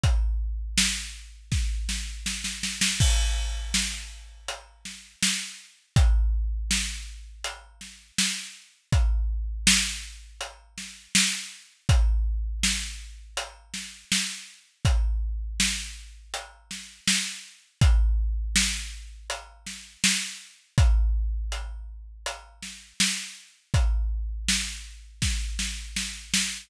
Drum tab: CC |----------------|x---------------|----------------|----------------|
HH |x---------------|--------x-------|x-------x-------|x-------x-------|
SD |----o---o-o-oooo|----o-----o-o---|----o-----o-o---|----o-----o-o---|
BD |o-------o-------|o---------------|o---------------|o---------------|

CC |----------------|----------------|----------------|----------------|
HH |x-------x-------|x-------x-------|x-------x-------|x---x---x-------|
SD |----o-----o-o---|----o-----o-o---|----o-----o-o---|----------o-o---|
BD |o---------------|o---------------|o---------------|o---------------|

CC |----------------|
HH |x---------------|
SD |----o---o-o-o-o-|
BD |o-------o-------|